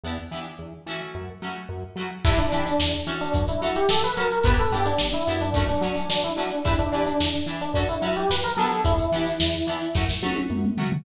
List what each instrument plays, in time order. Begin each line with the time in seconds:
0.03 synth bass 1 E2, acoustic guitar (steel) B3 D4 E4 G4
0.31 synth bass 1 E3, acoustic guitar (steel) B3 D4 E4 G4
0.59 synth bass 1 E2
0.86 synth bass 1 E3, acoustic guitar (steel) A3 C#4 E4 F#4
1.15 synth bass 1 F#2
1.42 synth bass 1 F#3, acoustic guitar (steel) A3 C#4 E4 F#4
1.69 synth bass 1 F#2
1.96 synth bass 1 F#3, acoustic guitar (steel) A3 C#4 E4 F#4
2.25 synth bass 1 E2, acoustic guitar (steel) D4 E4 G4 B4, electric piano 1 E4, kick, crash
2.38 electric piano 1 D4, snare, closed hi-hat
2.52 synth bass 1 E3, acoustic guitar (steel) D4 E4 G4 B4, electric piano 1 D4, closed hi-hat
2.66 electric piano 1 D4, closed hi-hat
2.79 synth bass 1 E2, snare
2.94 closed hi-hat
3.07 synth bass 1 E3, acoustic guitar (steel) C#4 F#4 A4, closed hi-hat
3.20 electric piano 1 D4, snare, closed hi-hat
3.34 synth bass 1 F#2, kick, closed hi-hat
3.48 electric piano 1 E4, closed hi-hat
3.61 synth bass 1 F#3, acoustic guitar (steel) C#4 F#4 A4, closed hi-hat
3.75 electric piano 1 G4, closed hi-hat
3.89 synth bass 1 F#2, electric piano 1 A4, snare
4.03 electric piano 1 B4, snare, closed hi-hat
4.16 synth bass 1 F#3, acoustic guitar (steel) C#4 F#4 A4, electric piano 1 A#4, closed hi-hat
4.31 closed hi-hat
4.43 synth bass 1 G1, acoustic guitar (steel) B3 D4 E4, electric piano 1 B4, kick, closed hi-hat
4.48 acoustic guitar (steel) G4
4.58 electric piano 1 A4, closed hi-hat
4.72 synth bass 1 G2, acoustic guitar (steel) B3 D4 E4 G4, electric piano 1 G4, closed hi-hat
4.86 electric piano 1 D4, closed hi-hat
4.99 synth bass 1 G1, snare
5.13 electric piano 1 E4, snare, closed hi-hat
5.27 synth bass 1 F#2, acoustic guitar (steel) B3 D4 E4 G4, snare, closed hi-hat
5.41 electric piano 1 D4, closed hi-hat
5.54 acoustic guitar (steel) A3 C#4 F#4, kick, closed hi-hat
5.68 electric piano 1 D4, snare, closed hi-hat
5.81 synth bass 1 F#3, acoustic guitar (steel) A3 C#4 F#4, closed hi-hat
5.96 electric piano 1 D4, closed hi-hat
6.09 synth bass 1 F#2, electric piano 1 D4, snare
6.24 electric piano 1 E4, snare, closed hi-hat
6.36 synth bass 1 F#3, acoustic guitar (steel) A3 C#4 F#4, electric piano 1 D4, closed hi-hat
6.50 closed hi-hat
6.65 synth bass 1 E2, acoustic guitar (steel) D4 E4 G4 B4, electric piano 1 E4, kick, closed hi-hat
6.78 electric piano 1 D4, closed hi-hat
6.92 synth bass 1 E3, electric piano 1 D4, acoustic guitar (steel) D4 E4 G4 B4, closed hi-hat
7.06 electric piano 1 D4, closed hi-hat
7.20 synth bass 1 E2, snare
7.34 closed hi-hat
7.46 synth bass 1 E3, acoustic guitar (steel) D4 E4 G4, closed hi-hat
7.50 acoustic guitar (steel) B4
7.61 electric piano 1 D4, closed hi-hat
7.74 synth bass 1 F#2, acoustic guitar (steel) C#4 F#4 A4, kick, closed hi-hat
7.89 electric piano 1 E4, closed hi-hat
8.01 synth bass 1 F#3, acoustic guitar (steel) C#4 F#4 A4, snare, closed hi-hat
8.16 electric piano 1 G4, closed hi-hat
8.29 synth bass 1 F#2, electric piano 1 B4, snare
8.44 electric piano 1 A#4, closed hi-hat
8.57 synth bass 1 F#3, acoustic guitar (steel) B3 D4 E4 G4, electric piano 1 A4, closed hi-hat
8.70 snare, closed hi-hat
8.84 synth bass 1 E2, electric piano 1 E4, kick, closed hi-hat
8.98 closed hi-hat
9.12 synth bass 1 E3, acoustic guitar (steel) B3 D4 E4 G4, closed hi-hat
9.26 snare, closed hi-hat
9.40 synth bass 1 E2, snare
9.53 snare, closed hi-hat
9.67 synth bass 1 E3, acoustic guitar (steel) B3 D4 E4 G4, closed hi-hat
9.81 closed hi-hat
9.95 synth bass 1 F#2, acoustic guitar (steel) A3 C#4 F#4, kick, snare
10.09 snare
10.22 synth bass 1 F#3, acoustic guitar (steel) A3 C#4 F#4, high tom
10.36 high tom
10.50 synth bass 1 F#2, mid tom
10.65 mid tom
10.77 synth bass 1 F#3, acoustic guitar (steel) A3 C#4 F#4, floor tom
10.92 floor tom